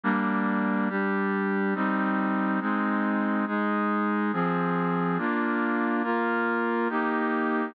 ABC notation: X:1
M:3/4
L:1/8
Q:1/4=70
K:Cm
V:1 name="Brass Section"
[G,B,D]2 [G,DG]2 [G,CE]2 | [A,CE]2 [A,EA]2 [F,CA]2 | [B,DF]2 [B,FB]2 [B,EG]2 |]